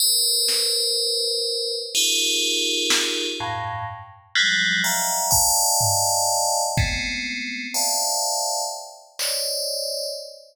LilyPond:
<<
  \new Staff \with { instrumentName = "Tubular Bells" } { \time 7/8 \tempo 4 = 62 <bes' b' c''>2 <ees' f' g' aes' bes'>4. | <f, g, a,>8 r8 <f ges g aes>8 <ees'' e'' f'' g'' aes'' bes''>8 <d'' ees'' f'' g'' aes'' a''>4. | <aes a b c'>4 <c'' d'' e'' f'' g'' a''>4 r8 <c'' des'' d'' ees''>4 | }
  \new DrumStaff \with { instrumentName = "Drums" } \drummode { \time 7/8 r8 sn8 r4 r4 sn8 | r4 r4 bd8 tomfh4 | bd4 r4 r8 hc4 | }
>>